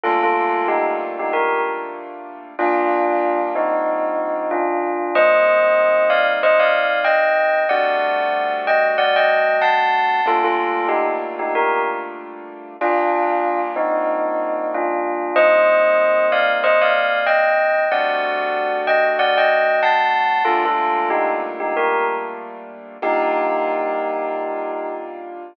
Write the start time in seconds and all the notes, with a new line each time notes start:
0.03 G3 A3 A#3 D4 F4 A4
0.23 F4 A4
0.68 D#4 G4
1.19 D#4 G4
1.33 G4 A#4
2.59 G3 A#3 D4 F4
3.55 C4 D#4
4.51 D4 F4
5.15 G3 A#3 C4 D#4 C5 D#5
6.10 D5 F5
6.43 C5 D#5
6.59 D5 F5
7.04 D#5 G5
7.69 G3 A3 C4 D4 F#4 D5 F#5
8.67 D#5 G5
8.98 D5 F#5
9.16 D#5 G5
9.62 F#5 A5
10.26 G3 A3 A#3 D4 F4 A4
10.44 F4 A4
10.89 D#4 G4
11.39 D#4 G4
11.55 G4 A#4
12.81 G3 A#3 D4 F4
13.76 C4 D#4
14.74 D4 F4
15.36 G3 A#3 C4 D#4 C5 D#5
16.32 D5 F5
16.64 C5 D#5
16.81 D5 F5
17.26 D#5 G5
17.91 G3 A3 C4 D4 F#4 D5 F#5
18.87 D#5 G5
19.19 D5 F#5
19.38 D#5 G5
19.83 F#5 A5
20.45 G3 A3 A#3 D4 F4 A4
20.65 F4 A4
21.10 D#4 G4
21.60 D#4 G4
21.77 G4 A#4
23.02 G3 A#3 D4 D#4 F4 G4